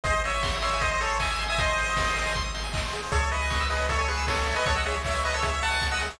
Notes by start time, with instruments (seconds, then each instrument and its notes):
0.04 synth bass 1 G#1, lead 1 (square) G#4 C5 D#5, kick, closed hi-hat
0.14 lead 1 (square) C5
0.24 lead 1 (square) C#5 D#5 E5, open hi-hat
0.34 lead 1 (square) G#5
0.43 lead 1 (square) C6, kick, snare
0.54 lead 1 (square) D#6
0.61 lead 1 (square) C#5 E5 C6, open hi-hat
0.74 lead 1 (square) G#5
0.80 lead 1 (square) C5 D#5, kick, closed hi-hat
0.91 lead 1 (square) C5 D#5
1.01 lead 1 (square) G#4 A4 C#5, open hi-hat
1.10 lead 1 (square) C5
1.20 lead 1 (square) D#5 E5 G#5, kick, clap
1.31 lead 1 (square) G#5
1.39 lead 1 (square) C6, open hi-hat
1.48 lead 1 (square) E5 G#5 D#6
1.58 lead 1 (square) C5 D#5 C6, kick, closed hi-hat
1.68 lead 1 (square) G#5
1.78 lead 1 (square) D#5, open hi-hat
1.86 lead 1 (square) C5
1.96 lead 1 (square) G#4, kick, snare
2.05 lead 1 (square) C5
2.16 lead 1 (square) D#5, open hi-hat
2.26 lead 1 (square) G#5
2.34 lead 1 (square) C6, kick, closed hi-hat
2.43 lead 1 (square) D#6
2.54 lead 1 (square) C6, open hi-hat
2.64 lead 1 (square) G#5
2.73 lead 1 (square) D#5, kick, clap
2.85 lead 1 (square) C5
2.93 lead 1 (square) G#4, open hi-hat
3.03 lead 1 (square) C5
3.12 synth bass 1 C#2, lead 1 (square) G#4 A4 C#5, kick, closed hi-hat
3.21 lead 1 (square) C#5
3.31 lead 1 (square) B4 D#5 E5, open hi-hat
3.42 lead 1 (square) G#5
3.50 lead 1 (square) C#6, kick, snare
3.60 lead 1 (square) E6
3.70 lead 1 (square) G#4 B4 D#5, open hi-hat
3.79 lead 1 (square) C#5
3.89 lead 1 (square) A4 C#5 E5, kick, closed hi-hat
3.98 lead 1 (square) A4 C#5 G#5
4.08 lead 1 (square) G#4 B4 C#6, open hi-hat
4.17 lead 1 (square) E6
4.27 lead 1 (square) G#4 A4 C#5, kick, snare
4.39 lead 1 (square) C#5
4.47 lead 1 (square) E5, open hi-hat
4.55 lead 1 (square) B4 D#5 G#5
4.65 synth bass 1 C#2, lead 1 (square) A4 C#5 C#6, kick, closed hi-hat
4.75 lead 1 (square) D#5 F#5 E6
4.85 lead 1 (square) G#4 C#5 E5, open hi-hat
4.94 lead 1 (square) C#5
5.04 lead 1 (square) C#5 E5, kick, clap
5.15 lead 1 (square) G#5
5.24 lead 1 (square) B4 D#5 C#6, open hi-hat
5.34 lead 1 (square) A4 C#5 E6
5.42 lead 1 (square) G#4 C#5 E5, kick, closed hi-hat
5.54 lead 1 (square) C#5
5.61 lead 1 (square) E5 F#5 A5, open hi-hat
5.71 lead 1 (square) G#5
5.80 lead 1 (square) C#6, kick, snare
5.91 lead 1 (square) D#5 F#5 E6
6.00 lead 1 (square) G#4, open hi-hat
6.10 lead 1 (square) C#5